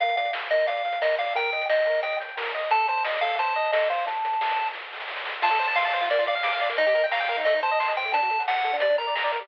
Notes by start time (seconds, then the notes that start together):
0.00 A#1 A#4 F5, kick, closed hi-hat
0.09 closed hi-hat
0.17 A#2 D5 F5, closed hi-hat
0.25 closed hi-hat
0.33 A#1 F5, snare
0.42 closed hi-hat
0.50 A#2 A#4 D#5, closed hi-hat
0.60 closed hi-hat
0.67 A#1 D5 F5, kick, closed hi-hat
0.77 closed hi-hat
0.85 A#2 F5, closed hi-hat
0.92 closed hi-hat
1.01 A#1 A#4 D#5, snare
1.11 closed hi-hat
1.18 A#2 D5 F5, closed hi-hat
1.26 closed hi-hat
1.35 D#2 A#4 G5, kick, closed hi-hat
1.44 closed hi-hat
1.52 D#3 D#5, closed hi-hat
1.61 closed hi-hat
1.69 D#2 D#5 G5, snare
1.78 closed hi-hat
1.85 D#3 A#4, closed hi-hat
1.94 closed hi-hat
2.03 D#2 D#5 G5, kick, closed hi-hat
2.12 closed hi-hat
2.19 D#3 G5, kick, closed hi-hat
2.29 closed hi-hat
2.37 D#2 A#4, snare
2.46 closed hi-hat
2.54 D#3 D#5, closed hi-hat
2.63 closed hi-hat
2.71 A1 A4 A5, kick, closed hi-hat
2.80 closed hi-hat
2.88 A2 C5 A5, closed hi-hat
2.98 closed hi-hat
3.04 A1 D#5, snare
3.14 closed hi-hat
3.21 A2 A4 F5, closed hi-hat
3.31 closed hi-hat
3.39 A1 C5 A5, kick, closed hi-hat
3.47 closed hi-hat
3.55 A2 D#5, closed hi-hat
3.64 kick, closed hi-hat
3.72 A1 A4 D#5, snare
3.82 closed hi-hat
3.89 A2 C5 F5, closed hi-hat
3.98 closed hi-hat
4.06 D2 A5, kick, closed hi-hat
4.16 closed hi-hat
4.24 D3, closed hi-hat
4.31 kick, closed hi-hat
4.41 D2, snare
4.50 closed hi-hat
4.56 D3, closed hi-hat
4.66 closed hi-hat
4.73 D2, kick, snare
4.92 D3, snare
5.00 snare
5.08 D2, snare
5.16 snare
5.25 D3, snare
5.42 F4 A5, kick, crash
5.50 A4, kick, closed hi-hat
5.59 C5, closed hi-hat
5.68 A5, closed hi-hat
5.75 F5 C6, snare
5.85 A5, closed hi-hat
5.93 C5, closed hi-hat
6.01 F4, closed hi-hat
6.10 A#3 D5, kick, closed hi-hat
6.18 F4, kick, closed hi-hat
6.26 D5 F5, closed hi-hat
6.35 F5, closed hi-hat
6.43 D6, snare
6.53 F5, closed hi-hat
6.61 D5, closed hi-hat
6.69 A#3, closed hi-hat
6.77 D#4 D#5, kick, closed hi-hat
6.87 G4, kick, closed hi-hat
6.95 A#4, closed hi-hat
7.04 G5, closed hi-hat
7.11 F5 A#5, snare
7.20 G5, closed hi-hat
7.28 A#4, closed hi-hat
7.37 D#4, closed hi-hat
7.45 A3 D#5, kick, closed hi-hat
7.54 D#4, kick, closed hi-hat
7.63 C5 A5, closed hi-hat
7.71 D#5, closed hi-hat
7.80 C6, snare
7.87 D#5, closed hi-hat
7.95 C5 G5, closed hi-hat
8.05 A3, closed hi-hat
8.12 D4 A5, kick, closed hi-hat
8.22 F#4, kick, closed hi-hat
8.30 A4, closed hi-hat
8.39 F#5, closed hi-hat
8.47 F#5 A5, snare
8.55 F#5, closed hi-hat
8.64 A4, closed hi-hat
8.73 D4, closed hi-hat
8.80 G3 D5, kick, closed hi-hat
8.89 D4, kick, closed hi-hat
8.98 A#4 A#5, closed hi-hat
9.07 D5, closed hi-hat
9.15 A#5, snare
9.24 D5, closed hi-hat
9.32 A#4, closed hi-hat
9.40 G3, closed hi-hat